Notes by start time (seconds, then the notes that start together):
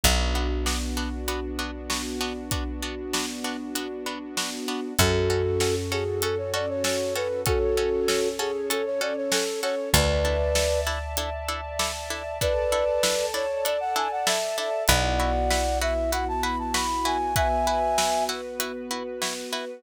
0.03 B1 B3 D4 F#4, kick, closed hi-hat
0.35 B3 D4 F#4
0.66 B3 D4 F#4, snare
0.97 B3 D4 F#4
1.28 B3 D4 F#4, closed hi-hat
1.59 B3 D4 F#4
1.90 B3 D4 F#4, snare
2.21 B3 D4 F#4
2.51 B3 D4 F#4, kick, closed hi-hat
2.82 B3 D4 F#4
3.13 B3 D4 F#4, snare
3.44 B3 D4 F#4
3.75 B3 D4 F#4, closed hi-hat
4.06 B3 D4 F#4
4.37 B3 D4 F#4, snare
4.68 B3 D4 F#4
4.98 F#2 C#4 F#4 A4, kick, closed hi-hat
5.30 C#4 F#4 A4
5.60 C#4 F#4 A4, snare
5.92 C#4 F#4 G#4 A4
6.22 C#4 F#4 A4, closed hi-hat
6.38 C#5
6.54 C#4 F#4 A4 D5
6.69 C#5
6.84 C#4 F#4 A4 C#5, snare
7.15 C#4 F#4 A4 B4
7.46 C#4 F#4 A4 C#5, kick, closed hi-hat
7.77 C#4 F#4 A4
8.08 C#4 F#4 A4, snare
8.39 C#4 F#4 G#4 A4
8.70 C#4 F#4 A4, closed hi-hat
8.85 C#5
9.01 C#4 F#4 A4 D5
9.16 C#5
9.32 C#4 F#4 A4, snare
9.63 C#4 F#4 A4 C#5
9.93 D2 D4 E4 A4 B4 D5 E5 A5, kick, closed hi-hat
10.25 D4 E4 A4
10.55 D4 E4 A4, snare
10.87 D4 E4 A4
11.17 D4 E4 A4, closed hi-hat
11.48 D4 E4 A4
11.79 D4 E4 A4, snare
12.10 D4 E4 A4
12.41 D4 E4 A4 B4 D5 A5, kick, closed hi-hat
12.72 D4 E4 A4
13.03 D4 E4 A4, snare
13.34 D4 E4 A4 C#5
13.65 D4 E4 A4 D5, closed hi-hat
13.80 F#5
13.96 D4 E4 A4 G#5
14.11 F#5
14.27 D4 E4 A4 E5, snare
14.57 D4 E4 A4 E5
14.88 B1 B3 E4 F#4 B4 D5 F#5, kick, closed hi-hat
15.20 E4 F#4 B4
15.51 E4 F#4 B4, snare
15.81 E4 F#4 B4 E5
16.12 E4 F#4 B4 F#5, closed hi-hat
16.28 A5
16.43 E4 F#4 B4 B5
16.59 A5
16.74 E4 F#4 B4 B5, snare
17.05 E4 F#4 B4 G#5
17.35 B3 E4 F#4 B4 E5 G#5, kick, closed hi-hat
17.67 E4 F#4 B4
17.98 E4 F#4 B4, snare
18.29 E4 F#4 B4
18.60 E4 F#4 B4, closed hi-hat
18.91 E4 F#4 B4
19.22 E4 F#4 B4, snare
19.53 E4 F#4 B4